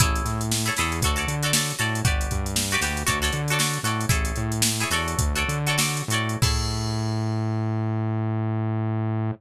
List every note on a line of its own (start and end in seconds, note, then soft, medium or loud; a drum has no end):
0.00 0.22 A1 medium
0.00 0.43 E4 loud
0.00 0.43 G#4 loud
0.00 0.43 A4 loud
0.00 0.43 C#5 medium
0.00 kick loud
0.00 closed hi-hat loud
0.15 closed hi-hat medium
0.25 0.70 A2 medium
0.25 snare soft
0.25 closed hi-hat medium
0.41 closed hi-hat medium
0.51 snare medium
0.66 0.74 E4 loud
0.66 0.74 G#4 medium
0.66 0.74 A4 medium
0.66 0.74 C#5 loud
0.66 closed hi-hat medium
0.76 1.01 E2 medium
0.76 0.99 E4 medium
0.76 0.99 G#4 loud
0.76 0.99 A4 medium
0.76 snare medium
0.76 closed hi-hat medium
0.81 0.99 C#5 medium
0.92 closed hi-hat medium
1.02 1.25 D2 loud
1.02 1.15 F#4 loud
1.02 1.16 A4 loud
1.02 1.16 C#5 loud
1.02 kick medium
1.02 closed hi-hat medium
1.07 1.16 D5 loud
1.16 1.35 F#4 medium
1.16 1.35 A4 loud
1.16 1.35 C#5 medium
1.16 1.35 D5 loud
1.16 closed hi-hat medium
1.27 1.73 D3 medium
1.27 closed hi-hat medium
1.43 1.51 F#4 loud
1.43 1.51 A4 loud
1.43 1.51 C#5 medium
1.43 1.51 D5 loud
1.43 closed hi-hat medium
1.53 1.75 F#4 medium
1.53 1.75 A4 loud
1.53 1.75 C#5 medium
1.53 1.75 D5 loud
1.53 snare loud
1.70 closed hi-hat medium
1.79 2.02 A2 medium
1.79 2.00 F#4 medium
1.79 2.00 A4 loud
1.79 2.00 C#5 medium
1.79 2.00 D5 medium
1.79 closed hi-hat medium
1.95 closed hi-hat medium
2.05 2.28 G1 medium
2.05 2.48 F#4 loud
2.05 2.48 G4 loud
2.05 2.48 B4 loud
2.05 2.48 D5 loud
2.05 kick loud
2.05 closed hi-hat medium
2.21 closed hi-hat medium
2.31 2.77 G2 medium
2.31 kick medium
2.31 closed hi-hat medium
2.46 closed hi-hat medium
2.56 snare loud
2.71 2.80 F#4 loud
2.71 2.80 G4 loud
2.71 2.80 B4 loud
2.71 closed hi-hat medium
2.75 2.80 D5 loud
2.81 3.04 D2 medium
2.81 3.03 F#4 medium
2.81 3.03 G4 loud
2.81 3.03 B4 medium
2.81 3.03 D5 medium
2.81 snare medium
2.81 closed hi-hat medium
2.97 closed hi-hat medium
3.07 3.31 D2 medium
3.07 3.19 F#4 loud
3.07 3.19 A4 loud
3.07 3.19 C#5 loud
3.07 3.19 D5 loud
3.07 kick medium
3.07 closed hi-hat medium
3.22 3.41 F#4 medium
3.22 3.41 A4 loud
3.22 3.41 C#5 loud
3.22 3.41 D5 loud
3.22 snare soft
3.22 closed hi-hat medium
3.32 3.78 D3 medium
3.32 closed hi-hat medium
3.48 3.58 F#4 loud
3.48 3.59 A4 loud
3.48 closed hi-hat medium
3.52 3.59 C#5 medium
3.52 3.59 D5 loud
3.59 3.80 F#4 loud
3.59 3.80 A4 medium
3.59 3.80 C#5 medium
3.59 3.80 D5 medium
3.59 snare loud
3.74 closed hi-hat medium
3.83 4.06 A2 medium
3.83 4.06 F#4 medium
3.83 4.06 A4 medium
3.83 4.06 C#5 loud
3.83 4.06 D5 medium
3.83 closed hi-hat medium
4.01 closed hi-hat medium
4.09 4.33 A1 medium
4.09 4.53 E4 loud
4.09 4.53 G#4 loud
4.09 4.53 A4 loud
4.09 4.53 C#5 medium
4.09 kick loud
4.09 closed hi-hat loud
4.25 closed hi-hat medium
4.36 4.84 A2 medium
4.36 closed hi-hat medium
4.52 closed hi-hat medium
4.62 snare loud
4.80 4.89 E4 loud
4.80 4.89 G#4 medium
4.80 4.89 A4 medium
4.80 4.89 C#5 loud
4.80 closed hi-hat medium
4.90 5.15 E2 medium
4.90 5.33 F#4 loud
4.90 5.33 A4 loud
4.90 5.33 C#5 loud
4.90 5.33 D5 loud
4.90 snare medium
4.90 closed hi-hat medium
5.08 closed hi-hat medium
5.18 5.44 D2 medium
5.18 kick medium
5.18 closed hi-hat loud
5.35 5.58 F#4 loud
5.35 5.58 A4 loud
5.35 5.58 C#5 loud
5.35 5.58 D5 loud
5.35 closed hi-hat medium
5.48 6.02 D3 medium
5.48 closed hi-hat medium
5.67 5.77 F#4 loud
5.67 5.77 A4 medium
5.67 5.77 C#5 medium
5.67 5.77 D5 loud
5.67 closed hi-hat medium
5.78 6.04 F#4 loud
5.78 6.04 A4 medium
5.78 6.04 C#5 loud
5.78 6.04 D5 medium
5.78 snare loud
5.97 closed hi-hat medium
6.08 6.37 A2 medium
6.08 6.38 F#4 medium
6.08 6.38 A4 medium
6.08 closed hi-hat medium
6.13 6.38 C#5 medium
6.13 6.38 D5 loud
6.29 closed hi-hat medium
6.42 9.31 A2 loud
6.42 9.31 E4 medium
6.42 9.31 G#4 loud
6.42 9.31 A4 loud
6.42 9.31 C#5 loud
6.42 kick loud
6.42 crash loud